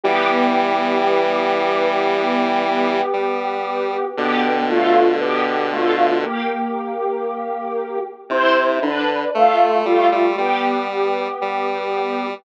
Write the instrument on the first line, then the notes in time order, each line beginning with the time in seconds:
lead 1 (square)
0.03 E3 G3 B3 G4
3.13 G3
4.17 B2 D3 B3 G4
4.70 A3 F4
5.21 B3 G4
5.72 A3 F4
6.23 A#3 G4
8.29 C3 E4 C5
8.82 D3 D4 B4
9.34 A3 F4
9.85 G3 A3 F4
10.12 G3
10.38 G3 B3 G4
11.41 G3